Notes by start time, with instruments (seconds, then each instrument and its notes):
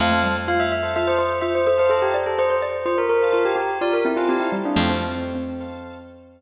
0.00 electric bass (finger) F2, xylophone A3, drawbar organ A4 C5 F5, tubular bells F5
0.11 xylophone A3
0.23 xylophone G3
0.48 xylophone F4, tubular bells F5
0.60 tubular bells E5
0.72 tubular bells E5
0.83 drawbar organ A4 C5 F5
0.96 xylophone F4, tubular bells E5
1.07 tubular bells C5
1.19 tubular bells C5
1.41 xylophone F4, tubular bells E5
1.55 tubular bells C5
1.67 xylophone A4, tubular bells C5
1.78 drawbar organ A4 C5 F5, tubular bells C5
1.90 xylophone A4, tubular bells A4
2.02 tubular bells G4
2.14 xylophone D5
2.26 tubular bells A4
2.38 xylophone C5, tubular bells C5
2.50 xylophone C5
2.62 xylophone D5
2.86 xylophone F4, tubular bells C5
2.98 tubular bells A#4
3.09 tubular bells A#4
3.22 drawbar organ A4 C5 F5
3.32 xylophone F4, tubular bells A#4
3.45 tubular bells G4
3.56 tubular bells G4
3.81 xylophone F4, tubular bells D5
3.93 tubular bells A#4
4.05 xylophone C4, tubular bells E4
4.16 tubular bells F4, drawbar organ A4 C5 F5
4.29 xylophone C4, tubular bells G4
4.40 tubular bells E4
4.52 xylophone G3
4.65 tubular bells D4
4.76 electric bass (finger) F2, xylophone F3 A3, tubular bells C4, drawbar organ A4 C5 F5
4.89 tubular bells C4
5.35 xylophone C4
5.60 drawbar organ A4 C5 F5